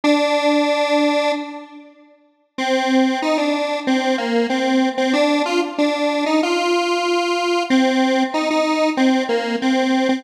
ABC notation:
X:1
M:4/4
L:1/16
Q:1/4=94
K:Ddor
V:1 name="Lead 1 (square)"
D10 z6 | [K:Fdor] C4 E D3 C2 B,2 C3 C | D2 F z D3 E F8 | C4 E E3 C2 B,2 C3 C |]